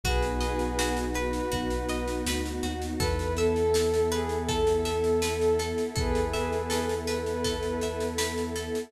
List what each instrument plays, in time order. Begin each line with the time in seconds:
0.04 synth bass 2 B1, pad 2 (warm) B3 D#4 F#4, pizzicato strings F#4, ocarina G#4 B4, kick, snare
0.23 snare
0.41 pizzicato strings D#5, snare
0.59 snare
0.79 pizzicato strings F#4, snare
0.97 snare
1.14 ocarina B4, pizzicato strings B4, snare
1.33 snare
1.52 synth bass 2 B1, pizzicato strings F#4, kick, snare
1.70 snare
1.89 pizzicato strings D#5, snare
2.08 snare
2.26 synth bass 2 D2, pizzicato strings B4, snare
2.46 snare
2.63 synth bass 2 D#2, pizzicato strings F#4, snare
2.82 snare
3.00 synth bass 2 E2, pad 2 (warm) B3 E4 A4, pizzicato strings A4, ocarina B4, kick, snare
3.19 snare
3.37 ocarina A4, pizzicato strings E5, snare
3.56 snare
3.74 pizzicato strings A4, snare
3.94 snare
4.12 ocarina G#4, pizzicato strings B4, snare
4.29 snare
4.48 ocarina A4, pizzicato strings A4, kick, snare
4.67 snare
4.85 pizzicato strings E5, snare
5.04 snare
5.22 pizzicato strings B4, snare
5.41 snare
5.59 pizzicato strings A4, snare
5.78 snare
5.96 synth bass 2 E2, ocarina G#4 B4, pizzicato strings A4, kick, snare
6.15 snare
6.33 pizzicato strings E5, snare
6.52 snare
6.70 pizzicato strings A4, snare
6.89 snare
7.07 pizzicato strings B4, ocarina B4, snare
7.26 snare
7.44 pizzicato strings A4, kick, snare
7.63 snare
7.81 pizzicato strings E5, snare
8.00 snare
8.18 pizzicato strings B4, snare
8.38 snare
8.56 pizzicato strings A4, snare
8.75 snare